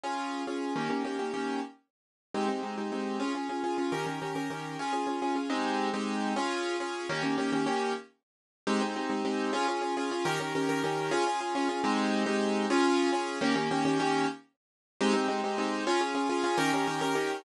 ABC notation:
X:1
M:5/8
L:1/8
Q:1/4=208
K:Ab
V:1 name="Acoustic Grand Piano"
[DFA]3 [DFA]2 | [M:6/8] [E,B,DG] [E,B,DG] [E,B,DG] [E,B,DG] [E,B,DG]2 | [M:5/8] z5 | [M:6/8] [A,CEG] [A,CEG] [A,CEG] [A,CEG] [A,CEG]2 |
[M:5/8] [DFA] [DFA] [DFA] [DFA] [DFA] | [M:6/8] [E,DGB] [E,DGB] [E,DGB] [E,DGB] [E,DGB]2 | [M:5/8] [DFA] [DFA] [DFA] [DFA] [DFA] | [M:6/8] [A,CEG]3 [A,CEG]3 |
[M:5/8] [DFA]3 [DFA]2 | [M:6/8] [E,B,DG] [E,B,DG] [E,B,DG] [E,B,DG] [E,B,DG]2 | [M:5/8] z5 | [M:6/8] [A,CEG] [A,CEG] [A,CEG] [A,CEG] [A,CEG]2 |
[M:5/8] [DFA] [DFA] [DFA] [DFA] [DFA] | [M:6/8] [E,DGB] [E,DGB] [E,DGB] [E,DGB] [E,DGB]2 | [M:5/8] [DFA] [DFA] [DFA] [DFA] [DFA] | [M:6/8] [A,CEG]3 [A,CEG]3 |
[M:5/8] [DFA]3 [DFA]2 | [M:6/8] [E,B,DG] [E,B,DG] [E,B,DG] [E,B,DG] [E,B,DG]2 | [M:5/8] z5 | [M:6/8] [A,CEG] [A,CEG] [A,CEG] [A,CEG] [A,CEG]2 |
[M:5/8] [DFA] [DFA] [DFA] [DFA] [DFA] | [M:6/8] [E,DGB] [E,DGB] [E,DGB] [E,DGB] [E,DGB]2 |]